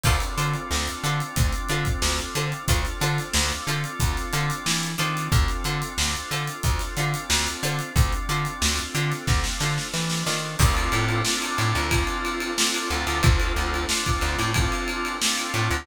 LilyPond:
<<
  \new Staff \with { instrumentName = "Pizzicato Strings" } { \time 4/4 \key d \minor \tempo 4 = 91 <d' f' a' c''>8 <d' f' a' c''>4 <d' f' a' c''>4 <d' f' a' c''>4 <d' f' a' c''>8 | <d' f' a' c''>8 <d' f' a' c''>4 <d' f' a' c''>4 <d' f' a' c''>4 <d' f' a' c''>8~ | <d' f' a' c''>8 <d' f' a' c''>4 <d' f' a' c''>4 <d' f' a' c''>4 <d' f' a' c''>8~ | <d' f' a' c''>8 <d' f' a' c''>4 <d' f' a' c''>4 <d' f' a' c''>4 <d' f' a' c''>8 |
r1 | r1 | }
  \new Staff \with { instrumentName = "Drawbar Organ" } { \time 4/4 \key d \minor <c' d' f' a'>1 | <c' d' f' a'>2.~ <c' d' f' a'>8 <c' d' f' a'>8~ | <c' d' f' a'>1 | <c' d' f' a'>1 |
<c' d' f' a'>4 <c' d' f' a'>4 <c' d' f' a'>4 <c' d' f' a'>8 <c' d' f' a'>8~ | <c' d' f' a'>4 <c' d' f' a'>4 <c' d' f' a'>4 <c' d' f' a'>4 | }
  \new Staff \with { instrumentName = "Electric Bass (finger)" } { \clef bass \time 4/4 \key d \minor d,8 d8 d,8 d8 d,8 d8 d,8 d8 | d,8 d8 d,8 d8 d,8 d8 e8 ees8 | d,8 d8 d,8 d8 d,8 d8 d,8 d8 | d,8 d8 d,8 d8 d,8 d8 e8 ees8 |
d,8 a,4 a,16 d,4.~ d,16 d,16 d,16 | d,8 d,4 d,16 a,4.~ a,16 a,16 d,16 | }
  \new DrumStaff \with { instrumentName = "Drums" } \drummode { \time 4/4 <cymc bd>16 hh16 hh16 hh16 sn16 hh16 hh16 hh16 <hh bd>16 hh16 hh16 <hh bd>16 sn16 hh16 hh16 hh16 | <hh bd>16 <hh sn>16 <hh sn>16 <hh sn>16 sn16 <hh sn>16 hh16 hh16 <hh bd>16 <hh sn>16 hh16 hh16 sn16 <hh sn>16 hh16 hh16 | <hh bd>16 <hh sn>16 hh16 hh16 sn16 hh16 hh16 hh16 <hh bd>16 <hh sn>16 hh16 hh16 sn16 <hh sn>16 hh16 hh16 | <hh bd>16 hh16 hh16 hh16 sn16 hh16 hh16 <hh sn>16 <bd sn>16 sn16 sn16 sn16 sn16 sn16 sn8 |
<cymc bd>16 cymr16 cymr16 cymr16 sn16 cymr16 cymr16 cymr16 <bd cymr>16 cymr16 cymr16 cymr16 sn16 cymr16 cymr16 cymr16 | <bd cymr>16 cymr16 <cymr sn>16 cymr16 sn16 <bd cymr>16 <cymr sn>16 <cymr sn>16 <bd cymr>16 cymr16 cymr16 cymr16 sn16 <cymr sn>16 cymr16 cymr16 | }
>>